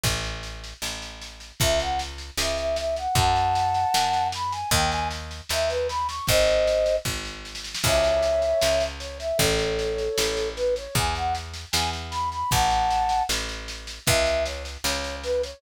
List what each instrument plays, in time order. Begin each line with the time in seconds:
0.03 electric bass (finger) A1, kick, snare
0.24 snare
0.43 snare
0.64 snare
0.82 electric bass (finger) A1, snare
1.02 snare
1.21 snare
1.40 snare
1.60 electric bass (finger) C#2, flute E5, kick, snare
1.79 flute F#5, snare
1.99 snare
2.18 snare
2.38 electric bass (finger) C#2, flute E5, snare
2.57 flute E5, snare
2.76 flute E5, snare
2.96 flute F#5, snare
3.15 electric bass (finger) F#2, flute F#5 A5, kick, snare
3.36 snare
3.55 snare
3.74 snare
3.94 electric bass (finger) F#2, snare
4.13 snare
4.32 flute B5, snare
4.51 flute G#5, snare
4.71 electric bass (finger) D#2, flute G5, kick, snare
4.90 flute G#5, snare
5.11 snare
5.31 snare
5.49 electric bass (finger) D#2, flute E5, snare
5.69 flute B4, snare
5.88 flute B5, snare
6.08 flute C#6, snare
6.27 electric bass (finger) G#1, flute C5 D#5, kick, snare
6.47 snare
6.67 snare
6.86 snare
7.05 electric bass (finger) G#1, kick, snare
7.25 snare
7.45 snare
7.55 snare
7.64 snare
7.75 snare
7.83 electric bass (finger) C#2, flute C#5 E5, kick, snare, crash
8.04 snare
8.23 snare
8.42 snare
8.62 electric bass (finger) C#2, snare
8.80 snare
9.00 flute C#5, snare
9.19 flute E5, snare
9.38 electric bass (finger) A1, flute A4 C#5, kick, snare
9.59 snare
9.79 snare
9.98 snare
10.18 electric bass (finger) A1, snare
10.37 snare
10.56 flute B4, snare
10.76 flute C#5, snare
10.95 electric bass (finger) E2, flute G#5, kick, snare
11.15 flute F#5, snare
11.35 snare
11.54 snare
11.72 electric bass (finger) E2, flute G#5, snare
11.93 snare
12.11 flute B5, snare
12.32 flute B5, snare
12.51 electric bass (finger) A1, flute F#5 A5, kick, snare
12.70 snare
12.90 snare
13.09 snare
13.29 electric bass (finger) A1, snare
13.49 snare
13.68 snare
13.87 snare
14.06 electric bass (finger) C#2, flute E5, kick, snare
14.26 snare
14.45 flute C#5, snare
14.65 snare
14.84 electric bass (finger) C#2, flute C#5, snare
15.04 snare
15.23 flute B4, snare
15.43 flute C#5, snare